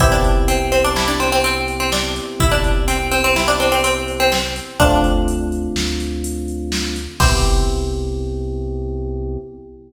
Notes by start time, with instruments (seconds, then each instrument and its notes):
0.00 synth bass 1 C2, electric piano 1 B3 C4 E4 G4, pizzicato strings E4, kick, closed hi-hat
0.12 pizzicato strings D4
0.24 closed hi-hat
0.48 pizzicato strings C4, closed hi-hat
0.72 pizzicato strings C4, closed hi-hat
0.84 pizzicato strings D4
0.96 pizzicato strings E4, snare
1.08 pizzicato strings D4
1.20 pizzicato strings C4, closed hi-hat
1.32 pizzicato strings C4
1.44 pizzicato strings C4, closed hi-hat
1.68 closed hi-hat
1.80 pizzicato strings C4
1.92 pizzicato strings D4, snare
2.16 closed hi-hat
2.40 synth bass 1 C2, pizzicato strings E4, kick, closed hi-hat
2.52 pizzicato strings D4
2.64 closed hi-hat
2.88 pizzicato strings C4, closed hi-hat
3.12 pizzicato strings C4, closed hi-hat
3.24 pizzicato strings C4
3.36 pizzicato strings E4, snare
3.48 pizzicato strings D4
3.60 pizzicato strings C4, closed hi-hat
3.72 pizzicato strings C4
3.84 pizzicato strings C4, closed hi-hat
4.08 closed hi-hat
4.20 pizzicato strings C4
4.32 pizzicato strings C4, snare
4.56 closed hi-hat
4.79 synth bass 1 D2, electric piano 1 A3 C4 D4 F4, pizzicato strings D4, kick, closed hi-hat
5.04 closed hi-hat
5.28 closed hi-hat
5.52 closed hi-hat
5.75 synth bass 1 D2, snare
6.00 closed hi-hat
6.24 closed hi-hat
6.48 closed hi-hat
6.72 snare
6.96 closed hi-hat
7.20 synth bass 1 C2, electric piano 1 B3 C4 E4 G4, pizzicato strings C4, kick, crash